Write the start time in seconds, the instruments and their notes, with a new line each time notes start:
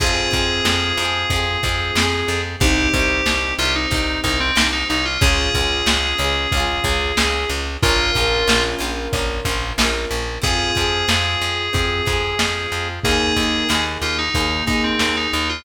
0.00 electric bass (finger) F2, acoustic grand piano C4 F4 G#4, acoustic guitar (steel) C4 F4, electric piano 2 G#4, kick, crash
0.06 acoustic guitar (steel) G#4
0.31 electric bass (finger) F2, acoustic guitar (steel) C4 F4, kick, closed hi-hat
0.37 acoustic guitar (steel) G#4
0.65 electric bass (finger) F2, snare
0.97 electric bass (finger) F2, acoustic guitar (steel) C4, closed hi-hat
1.02 acoustic guitar (steel) F4 G#4
1.30 electric bass (finger) F2, acoustic guitar (steel) C4 F4, kick, closed hi-hat
1.36 acoustic guitar (steel) G#4
1.63 electric bass (finger) F2, acoustic guitar (steel) C4 F4, kick, closed hi-hat
1.69 acoustic guitar (steel) G#4
1.95 electric bass (finger) F2, acoustic guitar (steel) C4 F4, snare
2.02 acoustic guitar (steel) G#4
2.28 electric bass (finger) F2, closed hi-hat
2.60 electric bass (finger) C2, acoustic grand piano C4 D#4 G4, acoustic guitar (steel) C4 D#4, electric piano 2 G4, kick, closed hi-hat
2.67 acoustic guitar (steel) G4
2.94 electric bass (finger) C2, acoustic guitar (steel) C4 D#4, kick, closed hi-hat
2.99 acoustic guitar (steel) G4
3.26 electric bass (finger) C2, snare
3.59 electric bass (finger) C2, acoustic guitar (steel) C4 D#4, electric piano 2 F4, closed hi-hat
3.65 acoustic guitar (steel) G4
3.75 electric piano 2 D#4
3.91 electric bass (finger) C2, acoustic guitar (steel) C4 D#4, kick, closed hi-hat
3.97 acoustic guitar (steel) G4
4.24 electric bass (finger) C2, acoustic guitar (steel) C4 D#4, electric piano 2 D#4, kick, closed hi-hat
4.30 acoustic guitar (steel) G4
4.40 electric piano 2 C4
4.55 electric bass (finger) C2, acoustic guitar (steel) C4 D#4, snare
4.61 acoustic guitar (steel) G4
4.72 electric piano 2 D#4
4.89 electric bass (finger) C2, electric piano 2 D#4, closed hi-hat
5.05 electric piano 2 F4
5.21 electric bass (finger) C#2, acoustic guitar (steel) C#4 F4, acoustic grand piano C#4 F4 G#4, electric piano 2 G#4, kick, closed hi-hat
5.27 acoustic guitar (steel) G#4
5.54 electric bass (finger) C#2, acoustic guitar (steel) C#4 F4, kick, closed hi-hat
5.61 acoustic guitar (steel) G#4
5.86 electric bass (finger) C#2, snare
6.18 electric bass (finger) C#2, acoustic guitar (steel) C#4 F4, closed hi-hat
6.24 acoustic guitar (steel) G#4
6.52 electric bass (finger) C#2, acoustic guitar (steel) C#4, kick, closed hi-hat
6.57 acoustic guitar (steel) F4 G#4
6.84 electric bass (finger) C#2, acoustic guitar (steel) C#4 F4, kick, closed hi-hat
6.90 acoustic guitar (steel) G#4
7.17 electric bass (finger) C#2, acoustic guitar (steel) C#4 F4, snare
7.23 acoustic guitar (steel) G#4
7.49 electric bass (finger) C#2, closed hi-hat
7.82 electric bass (finger) A#1, acoustic grand piano C#4 F4 A#4, acoustic guitar (steel) C#4 F4, electric piano 2 F4, kick, closed hi-hat
7.89 acoustic guitar (steel) A#4
8.14 electric bass (finger) A#1, acoustic guitar (steel) C#4 F4, kick, closed hi-hat
8.21 acoustic guitar (steel) A#4
8.47 electric bass (finger) A#1, snare
8.79 electric bass (finger) A#1, acoustic guitar (steel) C#4 F4, closed hi-hat
8.84 acoustic guitar (steel) A#4
9.13 electric bass (finger) A#1, acoustic guitar (steel) C#4 F4, kick, closed hi-hat
9.19 acoustic guitar (steel) A#4
9.45 electric bass (finger) A#1, acoustic guitar (steel) C#4 F4, kick, closed hi-hat
9.51 acoustic guitar (steel) A#4
9.78 electric bass (finger) A#1, acoustic guitar (steel) C#4 F4, snare
9.85 acoustic guitar (steel) A#4
10.11 electric bass (finger) A#1, closed hi-hat
10.42 electric bass (finger) F2, acoustic guitar (steel) C4 F4, acoustic grand piano C4 F4 G#4, electric piano 2 G#4, kick, closed hi-hat
10.47 acoustic guitar (steel) G#4
10.75 electric bass (finger) F2, acoustic guitar (steel) C4 F4, kick, closed hi-hat
10.81 acoustic guitar (steel) G#4
11.08 electric bass (finger) F2, acoustic guitar (steel) C4 F4, snare
11.14 acoustic guitar (steel) G#4
11.41 electric bass (finger) F2, closed hi-hat
11.73 electric bass (finger) F2, acoustic guitar (steel) C4 F4, acoustic grand piano C4 F4 G#4, kick, closed hi-hat
11.79 acoustic guitar (steel) G#4
12.05 electric bass (finger) F2, acoustic guitar (steel) C4 F4, kick, closed hi-hat
12.12 acoustic guitar (steel) G#4
12.39 electric bass (finger) F2, snare
12.72 electric bass (finger) F2, closed hi-hat
13.04 electric bass (finger) D#2, acoustic grand piano A#3 D#4 G#4, acoustic guitar (steel) A#3, electric piano 2 G#4, kick, closed hi-hat
13.08 acoustic guitar (steel) D#4 G#4
13.36 electric bass (finger) D#2, acoustic guitar (steel) A#3, kick, closed hi-hat
13.40 acoustic guitar (steel) D#4 G#4
13.69 electric bass (finger) D#2, acoustic guitar (steel) A#3 D#4, snare
13.74 acoustic guitar (steel) G#4
14.02 electric bass (finger) D#2, electric piano 2 F4, closed hi-hat
14.18 electric piano 2 D#4
14.34 electric bass (finger) D#2, acoustic guitar (steel) A#3 D#4, acoustic grand piano A#3 D#4 G#4, kick, closed hi-hat
14.40 acoustic guitar (steel) G#4
14.66 electric bass (finger) D#2, acoustic guitar (steel) A#3 D#4, electric piano 2 D#4, kick, closed hi-hat
14.73 acoustic guitar (steel) G#4
14.84 electric piano 2 C4
14.99 electric bass (finger) D#2, snare
15.17 electric piano 2 D#4
15.32 electric bass (finger) D#2, electric piano 2 D#4, closed hi-hat
15.49 electric piano 2 F4